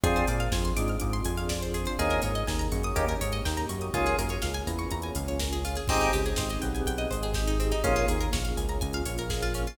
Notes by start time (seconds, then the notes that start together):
0.04 F2 C4 D4 F4 G#4, kick, closed hi-hat
0.16 C5, closed hi-hat
0.27 A#2 A#3 D5, open hi-hat
0.40 F5, closed hi-hat
0.52 F2 F3 G#5, kick, snare
0.65 C6, closed hi-hat
0.77 G#2 G#3 D6, open hi-hat
0.88 F6, closed hi-hat
1.00 G#2 G#3 D6, kick, closed hi-hat
1.13 C6, closed hi-hat
1.24 F2 F3 G#5, open hi-hat
1.38 F5, closed hi-hat
1.49 D5, kick, snare
1.63 C5, closed hi-hat
1.74 G#4, open hi-hat
1.85 C5, closed hi-hat
1.99 D#2 A#3 C#4 D#4 G#4, kick, closed hi-hat
2.10 A#4, closed hi-hat
2.22 G#2 G#3 C#5, open hi-hat
2.35 D#5, closed hi-hat
2.47 D#2 D#3 G#5, kick, snare
2.59 A#5, closed hi-hat
2.72 F#2 F#3 C#6, open hi-hat
2.83 D#6, closed hi-hat
2.96 D#2 A#3 C#4 D#4 G4, kick, closed hi-hat
3.08 A#4, closed hi-hat
3.21 G#2 G#3 C#5, open hi-hat
3.32 D#5, closed hi-hat
3.45 D#2 D#3 G5, kick, snare
3.57 A#5, closed hi-hat
3.69 F#2 F#3 C#6, open hi-hat
3.81 D#6, closed hi-hat
3.94 C#2 A#3 C#4 F4 G#4, kick, closed hi-hat
4.06 G#4, closed hi-hat
4.18 F#2 F#3 A#4, open hi-hat
4.29 C#5, closed hi-hat
4.42 C#2 C#3 F5, kick, snare
4.54 G#5, closed hi-hat
4.67 E2 E3 A#5, open hi-hat
4.79 C#6, closed hi-hat
4.91 E2 E3 A#5, kick, closed hi-hat
5.02 G#5, closed hi-hat
5.15 C#2 C#3 F5, open hi-hat
5.28 C#5, closed hi-hat
5.40 A#4, kick, snare
5.53 G#4, closed hi-hat
5.65 F4, open hi-hat
5.76 G#4, closed hi-hat
5.88 G#1 C4 D#4 G4 G#4, kick, crash
6.00 D#4, closed hi-hat
6.13 C#2 C#3 G4, open hi-hat
6.26 G#4, closed hi-hat
6.36 G#1 G#3 C5, kick, snare
6.49 D#5, closed hi-hat
6.62 B1 B3 G5, open hi-hat
6.75 G#5, closed hi-hat
6.86 B1 B3 G5, kick, closed hi-hat
6.98 D#5, closed hi-hat
7.11 G#1 G#3 C5, open hi-hat
7.23 G#4, closed hi-hat
7.34 G4, kick, snare
7.47 D#4, closed hi-hat
7.60 C4, open hi-hat
7.72 D#4, closed hi-hat
7.84 A#1 A#3 C#4 F4 G#4, kick, closed hi-hat
7.96 F4, closed hi-hat
8.08 D#2 D#3 G#4, open hi-hat
8.21 A#4, closed hi-hat
8.32 A#1 A#3 C#5, kick, snare
8.45 F5, closed hi-hat
8.57 C#2 C#3 G#5, open hi-hat
8.69 A#5, closed hi-hat
8.81 C#2 C#3 G#5, kick, closed hi-hat
8.93 F5, closed hi-hat
9.05 A#1 A#3 C#5, open hi-hat
9.18 A#4, closed hi-hat
9.30 G#4, kick, snare
9.42 F4, closed hi-hat
9.54 C#4, open hi-hat
9.67 F4, closed hi-hat